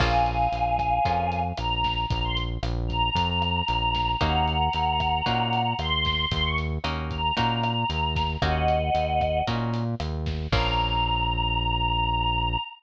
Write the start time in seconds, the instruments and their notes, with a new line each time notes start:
0.00 synth bass 1 A#1, acoustic guitar (steel) A#3 C#4 F4 G#4, choir aahs F5 G#5, kick, cross-stick, crash
0.26 closed hi-hat
0.52 synth bass 1 A#1, closed hi-hat
0.79 kick, cross-stick, closed hi-hat
1.05 synth bass 1 F2, acoustic guitar (steel) A#3 C#4 F4 G#4, kick, closed hi-hat
1.32 closed hi-hat
1.57 synth bass 1 A#1, choir aahs A#5, cross-stick, closed hi-hat
1.84 kick, snare, closed hi-hat
2.09 synth bass 1 A#1, choir aahs A#5, kick, closed hi-hat
2.24 choir aahs C6
2.37 closed hi-hat
2.63 synth bass 1 A#1, cross-stick, closed hi-hat
2.88 choir aahs A#5, kick, closed hi-hat
3.15 synth bass 1 F2, kick, closed hi-hat
3.42 cross-stick, closed hi-hat
3.68 synth bass 1 A#1, closed hi-hat
3.95 kick, snare, closed hi-hat
4.20 synth bass 1 D#2, acoustic guitar (steel) A#3 C#4 D#4 F#4, choir aahs F#5 A#5, kick, cross-stick, closed hi-hat
4.47 closed hi-hat
4.73 synth bass 1 D#2, closed hi-hat
5.00 kick, cross-stick, closed hi-hat
5.26 synth bass 1 A#2, acoustic guitar (steel) A#3 C#4 D#4 F#4, kick, closed hi-hat
5.53 closed hi-hat
5.79 synth bass 1 D#2, choir aahs C6, cross-stick, closed hi-hat
6.05 kick, snare, closed hi-hat
6.31 synth bass 1 D#2, choir aahs C6, kick, closed hi-hat
6.43 choir aahs C#6
6.58 closed hi-hat
6.84 synth bass 1 D#2, acoustic guitar (steel) A#3 C#4 D#4 F#4, cross-stick, closed hi-hat
7.10 choir aahs A#5, kick, closed hi-hat
7.37 synth bass 1 A#2, acoustic guitar (steel) A#3 C#4 D#4 F#4, kick, closed hi-hat
7.63 cross-stick, closed hi-hat
7.90 synth bass 1 D#2, closed hi-hat
8.16 kick, snare, closed hi-hat
8.42 synth bass 1 D#2, acoustic guitar (steel) A#3 C#4 D#4 F#4, choir aahs D#5 F#5, kick, cross-stick, closed hi-hat
8.68 closed hi-hat
8.95 synth bass 1 D#2, closed hi-hat
9.21 kick, cross-stick, closed hi-hat
9.47 synth bass 1 A#2, acoustic guitar (steel) A#3 C#4 D#4 F#4, kick, closed hi-hat
9.74 closed hi-hat
10.00 synth bass 1 D#2, cross-stick, closed hi-hat
10.26 kick, snare, closed hi-hat
10.52 synth bass 1 A#1, acoustic guitar (steel) A#3 C#4 F4 G#4, choir aahs A#5, kick, crash